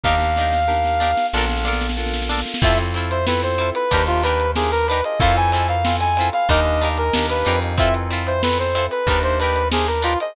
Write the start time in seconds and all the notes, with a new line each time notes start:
0.03 D#2 D4 D#4 G4 A#4 F5, kick, snare
0.08 A#4
0.20 snare
0.36 D4 D#4 G4, snare
0.41 A#4
0.52 snare
0.67 D4 D#4 G4 A#4, snare
0.85 snare
1.00 D4 D#4 G4 A#4, snare
1.17 snare
1.33 A#1 D4 F4 A4 A#4, snare
1.38 A#4, snare
1.49 snare
1.58 snare
1.65 D4 F4 A4 A#4, snare
1.73 snare
1.81 snare
1.89 snare
1.97 D4 F4 A4 A#4, snare
2.06 snare
2.14 snare
2.22 snare
2.29 D4 F4 A4 A#4, snare
2.38 snare
2.46 snare
2.54 snare
2.62 F2 C4 E4 F4 A4 E5, kick, crash
2.78 closed hi-hat
2.94 C4 E4 F4, closed hi-hat
2.99 A4
3.10 C5, closed hi-hat
3.26 C4 E4 F4 A4 B4, snare
3.43 C5, closed hi-hat
3.58 C4 E4 F4 A4, closed hi-hat
3.75 B4, closed hi-hat
3.91 D#2 D4 D#4 G4 A#4, kick, closed hi-hat
4.07 F4, snare, closed hi-hat
4.23 D4 D#4 G4 A#4 B4, closed hi-hat
4.40 closed hi-hat
4.55 D4 D#4 G4 G#4 A#4, snare
4.72 A#4, closed hi-hat
4.88 D4 D#4 G4 B4, snare, closed hi-hat
4.93 A#4
5.04 D#5, closed hi-hat
5.19 F2 C4 E4 F4 A4 F5, kick, closed hi-hat
5.24 A4
5.36 G#5, closed hi-hat
5.52 C4 E4 F4 G#5, closed hi-hat
5.56 A4
5.68 F5, closed hi-hat
5.85 C4 E4 F4 A4, snare
6.00 G#5, closed hi-hat
6.17 C4 E4, snare, closed hi-hat
6.21 F4 A4
6.33 F5, snare, closed hi-hat
6.49 D#2 D4 D#4 G4 A#4 D#5, kick, closed hi-hat
6.65 closed hi-hat
6.81 D4 D#4 G4 A#4, snare, closed hi-hat
6.97 A#4, closed hi-hat
7.14 D#2 D4 D#4 G4 A#4, snare
7.29 B4, closed hi-hat
7.45 F2 D4 D#4 G4 A#4, closed hi-hat
7.62 closed hi-hat
7.78 C4 E4 F4 A4 E5, kick, closed hi-hat
7.94 closed hi-hat
8.10 C4 E4 F4 A4, closed hi-hat
8.27 C5, closed hi-hat
8.42 C4 E4 F4 A4 B4, snare
8.59 C5, closed hi-hat
8.75 C4 E4 F4 A4, closed hi-hat
8.91 B4, closed hi-hat
9.07 D#2 D4 D#4 G4 A#4, kick, closed hi-hat
9.11 A#4
9.23 C5, closed hi-hat
9.40 D4 D#4 G4 B4, closed hi-hat
9.44 A#4
9.56 closed hi-hat
9.72 D4 D#4 G4 G#4 A#4, snare
9.88 A#4, snare, closed hi-hat
10.02 D4 D#4 F4 G4 A#4, closed hi-hat
10.20 D#5, closed hi-hat